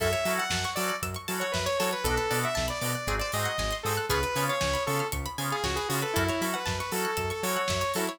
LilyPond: <<
  \new Staff \with { instrumentName = "Lead 2 (sawtooth)" } { \time 4/4 \key fis \minor \tempo 4 = 117 e''8. fis''8. d''8 r8. cis''16 b'16 cis''16 cis''16 b'16 | a'8. e''8 d''16 d''8. d''16 dis''4 a'8 | b'8. cis''8. a'8 r8. gis'16 fis'16 gis'16 fis'16 a'16 | e'8. b'8 b'16 a'8. a'16 cis''4 e'8 | }
  \new Staff \with { instrumentName = "Drawbar Organ" } { \time 4/4 \key fis \minor <cis' e' fis' a'>8 <cis' e' fis' a'>4 <cis' e' fis' a'>4 <cis' e' fis' a'>4 <cis' e' fis' a'>8 | <b d' fis' a'>8 <b d' fis' a'>4 <b d' fis' a'>8 <bis dis' fis' gis'>8 <bis dis' fis' gis'>4 <bis dis' fis' gis'>8 | <b cis' eis' gis'>8 <b cis' eis' gis'>4 <b cis' eis' gis'>4 <b cis' eis' gis'>4 <b cis' eis' gis'>8 | <cis' e' fis' a'>8 <cis' e' fis' a'>4 <cis' e' fis' a'>4 <cis' e' fis' a'>4 <cis' e' fis' a'>8 | }
  \new Staff \with { instrumentName = "Pizzicato Strings" } { \time 4/4 \key fis \minor a'16 cis''16 e''16 fis''16 a''16 cis'''16 e'''16 fis'''16 e'''16 cis'''16 a''16 fis''16 e''16 cis''16 a'16 cis''16 | a'16 b'16 d''16 fis''16 a''16 b''16 d'''16 fis'''16 gis'16 bis'16 dis''16 fis''16 gis''16 bis''16 dis'''16 fis'''16 | gis'16 b'16 cis''16 eis''16 gis''16 b''16 cis'''16 eis'''16 cis'''16 b''16 gis''16 eis''16 cis''16 b'16 gis'16 b'16 | a'16 cis''16 e''16 fis''16 a''16 cis'''16 e'''16 fis'''16 e'''16 cis'''16 a''16 fis''16 e''16 cis''16 a'16 cis''16 | }
  \new Staff \with { instrumentName = "Synth Bass 1" } { \clef bass \time 4/4 \key fis \minor fis,8 fis8 fis,8 fis8 fis,8 fis8 fis,8 fis8 | b,,8 b,8 b,,8 b,8 gis,,8 gis,8 gis,,8 gis,8 | cis,8 cis8 cis,8 cis8 cis,8 cis8 cis,8 cis8 | fis,8 fis8 fis,8 fis8 fis,8 fis8 fis,8 fis8 | }
  \new DrumStaff \with { instrumentName = "Drums" } \drummode { \time 4/4 <cymc bd>16 hh16 hho16 hh16 <bd sn>16 hh16 hho16 hh16 <hh bd>16 hh16 hho16 hh16 <bd sn>16 hh16 hho16 hh16 | <hh bd>16 hh16 hho16 hh16 <bd sn>16 hh16 hho16 hh16 <hh bd>16 hh16 hho16 hh16 <bd sn>16 hh16 hho16 hh16 | <hh bd>16 hh16 hho16 hh16 <bd sn>16 hh16 hho16 hh16 <hh bd>16 hh16 hho16 hh16 <bd sn>16 hh16 hho16 hh16 | <hh bd>16 hh16 hho16 hh16 <bd sn>16 hh16 hho16 hh16 <hh bd>16 hh16 hho16 hh16 <bd sn>16 hh16 hho16 hh16 | }
>>